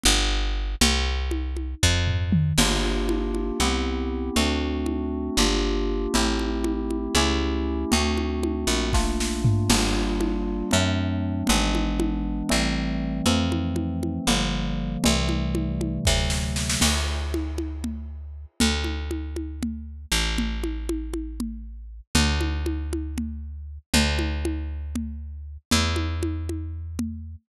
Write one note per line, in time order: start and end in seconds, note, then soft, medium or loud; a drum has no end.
0.03 0.75 G1 loud
0.03 low conga medium
0.81 1.75 C2 loud
0.81 low conga loud
1.31 high conga medium
1.57 high conga medium
1.83 2.53 F2 medium
1.83 kick medium
2.07 floor tom medium
2.32 mid tom loud
2.58 3.52 G1 medium
2.58 3.58 A#3 medium
2.58 3.58 D4 medium
2.58 3.58 F4 medium
2.58 3.58 G4 medium
2.58 crash loud
2.58 low conga loud
3.09 high conga medium
3.35 high conga medium
3.60 4.30 C2 medium
3.60 4.35 B3 medium
3.60 4.35 C4 medium
3.60 4.35 E4 medium
3.60 4.35 G4 medium
3.60 low conga medium
4.36 5.30 D2 medium
4.36 5.36 A3 medium
4.36 5.36 C4 medium
4.36 5.36 D4 medium
4.36 5.36 F#4 medium
4.36 low conga loud
4.86 high conga medium
5.37 6.07 G1 medium
5.37 6.13 A#3 medium
5.37 6.13 D4 medium
5.37 6.13 F4 medium
5.37 6.13 G4 medium
5.37 low conga medium
6.14 7.08 A1 medium
6.14 7.14 A3 medium
6.14 7.14 C4 medium
6.14 7.14 E4 medium
6.14 7.14 G4 medium
6.14 low conga loud
6.39 high conga medium
6.64 high conga medium
6.91 high conga medium
7.15 7.85 C#2 medium
7.15 7.91 A3 medium
7.15 7.91 C#4 medium
7.15 7.91 E4 loud
7.15 7.91 G4 medium
7.15 low conga medium
7.92 8.65 D2 medium
7.92 8.92 A3 medium
7.92 8.92 C4 medium
7.92 8.92 D4 medium
7.92 8.92 F#4 medium
7.92 low conga loud
8.17 high conga medium
8.43 high conga medium
8.67 9.63 A#1 medium
8.93 9.68 A3 medium
8.93 9.68 A#3 medium
8.93 9.68 D4 medium
8.93 9.68 F4 medium
8.93 kick medium
8.93 snare medium
9.20 snare medium
9.45 floor tom loud
9.69 10.63 G1 medium
9.69 10.70 G3 medium
9.69 10.70 A#3 medium
9.69 10.70 D4 medium
9.69 10.70 F4 medium
9.69 crash loud
9.69 low conga loud
10.21 high conga medium
10.71 11.43 F#2 medium
10.71 11.47 F#3 medium
10.71 11.47 A3 medium
10.71 11.47 C4 medium
10.71 11.47 D4 medium
10.71 low conga medium
11.47 12.43 G#1 medium
11.47 12.48 E3 medium
11.47 12.48 G#3 medium
11.47 12.48 B3 medium
11.47 12.48 D4 medium
11.47 low conga loud
11.75 high conga medium
12.00 high conga loud
12.49 13.22 A1 medium
12.49 13.25 E3 medium
12.49 13.25 G3 medium
12.49 13.25 A3 medium
12.49 13.25 C4 medium
12.49 low conga medium
13.26 14.19 F2 medium
13.26 14.26 E3 medium
13.26 14.26 F3 medium
13.26 14.26 A3 medium
13.26 14.26 C4 medium
13.26 low conga loud
13.52 high conga medium
13.76 high conga medium
14.03 high conga medium
14.27 14.97 G1 medium
14.27 15.02 D3 medium
14.27 15.02 F3 medium
14.27 15.02 G3 medium
14.27 15.02 A#3 medium
14.27 low conga medium
15.04 15.99 C2 medium
15.04 16.04 C3 medium
15.04 16.04 E3 loud
15.04 16.04 G3 medium
15.04 16.04 A3 medium
15.04 low conga loud
15.29 high conga medium
15.55 high conga medium
15.81 high conga medium
16.05 16.77 D2 medium
16.05 16.81 C3 medium
16.05 16.81 D3 medium
16.05 16.81 F#3 medium
16.05 16.81 A3 medium
16.05 kick medium
16.05 snare medium
16.30 snare medium
16.56 snare medium
16.69 snare loud
16.81 18.46 D2 medium
16.81 crash loud
16.81 low conga loud
17.34 high conga medium
17.58 high conga medium
17.84 low conga medium
18.60 20.06 D2 medium
18.60 low conga loud
18.84 high conga medium
19.11 high conga medium
19.36 high conga medium
19.63 low conga medium
20.12 22.01 A1 medium
20.38 low conga loud
20.64 high conga medium
20.89 high conga medium
21.14 high conga medium
21.40 low conga medium
22.15 23.78 D2 medium
22.15 low conga loud
22.41 high conga medium
22.66 high conga medium
22.93 high conga medium
23.18 low conga medium
23.94 25.57 D2 medium
23.94 low conga loud
24.19 high conga medium
24.45 high conga medium
24.95 low conga medium
25.71 27.36 E2 medium
25.71 low conga loud
25.96 high conga medium
26.23 high conga medium
26.49 high conga medium
26.99 low conga medium